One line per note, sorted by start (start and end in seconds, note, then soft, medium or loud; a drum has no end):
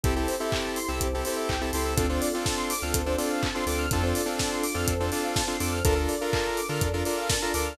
0.04 0.26 C2 medium
0.04 0.99 C4 medium
0.04 0.14 C4 loud
0.04 0.99 E4 medium
0.04 0.14 E4 medium
0.04 0.14 G4 medium
0.04 0.99 G4 medium
0.04 0.14 G4 medium
0.04 0.99 A4 medium
0.04 0.14 A4 medium
0.04 kick loud
0.04 closed hi-hat medium
0.16 0.35 C4 medium
0.16 0.35 E4 medium
0.16 0.35 G4 medium
0.16 0.35 A4 medium
0.16 0.27 A4 medium
0.28 0.39 C5 medium
0.28 open hi-hat medium
0.40 0.79 C4 medium
0.40 0.79 E4 medium
0.40 0.79 G4 medium
0.40 0.79 A4 medium
0.40 0.51 E5 medium
0.52 0.64 G5 medium
0.52 kick medium
0.52 clap loud
0.64 0.75 A5 medium
0.76 0.87 C6 medium
0.76 open hi-hat medium
0.88 0.99 C2 medium
0.88 1.07 C4 medium
0.88 1.07 E4 medium
0.88 1.07 G4 medium
0.88 1.07 A4 medium
0.88 1.00 E6 medium
1.01 1.22 C2 medium
1.01 1.96 C4 medium
1.01 1.96 E4 medium
1.01 1.12 G4 medium
1.01 1.96 A4 medium
1.01 1.96 C5 medium
1.01 kick medium
1.01 closed hi-hat loud
1.13 1.24 C4 medium
1.13 1.24 E4 medium
1.13 1.24 G4 medium
1.13 1.24 A4 medium
1.25 1.55 C4 medium
1.25 1.55 E4 medium
1.25 1.55 G4 medium
1.25 1.55 A4 medium
1.25 1.36 C5 medium
1.25 open hi-hat medium
1.37 1.48 E5 medium
1.49 1.71 C2 medium
1.49 1.60 G5 medium
1.49 kick medium
1.49 clap loud
1.61 1.71 C4 medium
1.61 1.71 E4 medium
1.61 1.71 G4 medium
1.61 1.71 A4 medium
1.61 1.72 A5 medium
1.73 1.95 C#2 medium
1.73 1.94 C4 medium
1.73 1.94 E4 medium
1.73 1.94 G4 medium
1.73 1.94 A4 medium
1.73 1.84 C6 medium
1.73 open hi-hat medium
1.85 1.96 E6 medium
1.97 2.19 D2 medium
1.97 2.06 C4 loud
1.97 2.93 C4 medium
1.97 2.06 D4 medium
1.97 2.93 D4 medium
1.97 2.06 F4 medium
1.97 2.93 F4 medium
1.97 2.06 A4 medium
1.97 2.93 A4 medium
1.97 2.08 A4 loud
1.97 kick loud
1.97 closed hi-hat loud
2.09 2.29 C4 medium
2.09 2.29 D4 medium
2.09 2.29 F4 medium
2.09 2.29 A4 medium
2.09 2.21 C5 medium
2.22 2.33 D5 medium
2.22 open hi-hat medium
2.33 2.73 C4 medium
2.33 2.73 D4 medium
2.33 2.73 F4 medium
2.33 2.73 A4 medium
2.33 2.44 F5 medium
2.46 2.56 A5 medium
2.46 kick medium
2.46 snare loud
2.58 2.68 C6 medium
2.70 2.81 D6 medium
2.70 open hi-hat medium
2.82 2.93 D2 medium
2.82 3.02 C4 medium
2.82 3.02 D4 medium
2.82 3.02 F4 medium
2.82 3.02 A4 medium
2.82 2.93 F6 medium
2.94 3.16 D2 medium
2.94 3.90 C4 medium
2.94 3.90 D4 medium
2.94 3.90 A4 medium
2.94 3.05 A4 medium
2.94 3.90 C5 medium
2.94 kick medium
2.94 closed hi-hat loud
3.06 3.16 C4 medium
3.06 3.16 D4 medium
3.06 3.16 F4 medium
3.06 3.16 A4 medium
3.06 3.17 C5 medium
3.18 3.47 C4 medium
3.18 3.47 D4 medium
3.18 3.47 F4 medium
3.18 3.47 A4 medium
3.18 3.29 D5 medium
3.18 open hi-hat medium
3.30 3.41 F5 medium
3.42 3.53 A5 medium
3.42 kick medium
3.42 clap loud
3.55 3.65 C4 medium
3.55 3.65 D4 medium
3.55 3.65 F4 medium
3.55 3.65 A4 medium
3.55 3.66 C6 medium
3.67 3.88 D2 medium
3.67 3.86 C4 medium
3.67 3.86 D4 medium
3.67 3.86 F4 medium
3.67 3.86 A4 medium
3.67 3.78 D6 medium
3.67 open hi-hat medium
3.79 3.89 F6 medium
3.91 4.13 F2 loud
3.91 4.87 C4 medium
3.91 4.02 C4 medium
3.91 4.87 D4 medium
3.91 4.02 D4 medium
3.91 4.87 F4 medium
3.91 4.02 F4 medium
3.91 4.87 A4 medium
3.91 4.02 A4 medium
3.91 kick loud
3.91 closed hi-hat loud
4.02 4.22 C4 medium
4.02 4.22 D4 medium
4.02 4.22 F4 medium
4.02 4.22 A4 medium
4.02 4.14 C5 medium
4.15 4.27 D5 medium
4.15 open hi-hat medium
4.26 4.64 C4 medium
4.26 4.64 D4 medium
4.26 4.64 F4 medium
4.26 4.64 A4 medium
4.26 4.38 F5 medium
4.39 4.51 A5 medium
4.39 kick medium
4.39 snare loud
4.51 4.62 C6 medium
4.64 4.75 D6 medium
4.64 open hi-hat medium
4.74 4.86 F2 medium
4.74 4.94 C4 medium
4.74 4.94 D4 medium
4.74 4.94 F4 medium
4.74 4.94 A4 medium
4.74 4.87 F6 medium
4.88 5.10 F2 medium
4.88 5.84 C4 medium
4.88 5.84 D4 medium
4.88 4.99 A4 medium
4.88 5.84 A4 medium
4.88 5.84 C5 medium
4.88 kick medium
4.88 closed hi-hat loud
5.00 5.10 C4 medium
5.00 5.10 D4 medium
5.00 5.10 F4 medium
5.00 5.10 A4 medium
5.00 5.11 C5 medium
5.12 5.41 C4 medium
5.12 5.41 D4 medium
5.12 5.41 F4 medium
5.12 5.41 A4 medium
5.12 5.23 D5 medium
5.12 open hi-hat medium
5.24 5.35 F5 medium
5.36 5.47 A5 medium
5.36 kick medium
5.36 snare loud
5.47 5.57 C4 medium
5.47 5.57 D4 medium
5.47 5.57 F4 medium
5.47 5.57 A4 medium
5.47 5.59 C6 medium
5.60 5.82 F2 medium
5.60 5.79 C4 medium
5.60 5.79 D4 medium
5.60 5.79 F4 medium
5.60 5.79 A4 medium
5.60 5.71 D6 medium
5.60 open hi-hat medium
5.73 5.84 F6 medium
5.84 6.07 D2 loud
5.84 6.80 D4 medium
5.84 5.94 D4 medium
5.84 6.80 F4 medium
5.84 5.94 F4 medium
5.84 6.80 A4 medium
5.84 5.94 A4 loud
5.84 5.96 A4 loud
5.84 6.80 A#4 medium
5.84 5.94 A#4 loud
5.84 kick loud
5.84 closed hi-hat loud
5.95 6.15 D4 medium
5.95 6.15 F4 medium
5.95 6.15 A4 medium
5.95 6.15 A#4 medium
5.95 6.08 A#4 medium
6.09 6.20 D5 medium
6.09 open hi-hat medium
6.21 6.60 D4 medium
6.21 6.60 F4 medium
6.21 6.60 A4 medium
6.21 6.60 A#4 medium
6.21 6.32 F5 medium
6.33 6.44 A5 medium
6.33 kick medium
6.33 clap loud
6.45 6.56 A#5 medium
6.57 6.68 D6 medium
6.57 open hi-hat medium
6.69 6.80 D3 medium
6.69 6.88 D4 medium
6.69 6.88 F4 medium
6.69 6.88 A4 medium
6.69 6.88 A#4 medium
6.69 6.80 F6 medium
6.81 7.03 F2 medium
6.81 7.77 D4 medium
6.81 7.77 F4 medium
6.81 6.93 A4 medium
6.81 7.77 A#4 medium
6.81 7.77 D5 medium
6.81 kick medium
6.81 closed hi-hat medium
6.93 7.03 D4 medium
6.93 7.03 F4 medium
6.93 7.03 A4 medium
6.93 7.03 A#4 medium
6.93 7.05 A#4 medium
7.05 7.35 D4 medium
7.05 7.35 F4 medium
7.05 7.35 A4 medium
7.05 7.35 A#4 medium
7.05 7.16 D5 medium
7.05 open hi-hat medium
7.18 7.28 F5 medium
7.30 7.41 A5 medium
7.30 kick medium
7.30 snare loud
7.42 7.52 D4 medium
7.42 7.52 F4 medium
7.42 7.52 A4 medium
7.42 7.52 A#4 medium
7.42 7.53 A#5 medium
7.54 7.76 D2 medium
7.54 7.73 D4 medium
7.54 7.73 F4 medium
7.54 7.73 A4 medium
7.54 7.73 A#4 medium
7.54 7.65 D6 medium
7.54 open hi-hat medium
7.66 7.77 F6 medium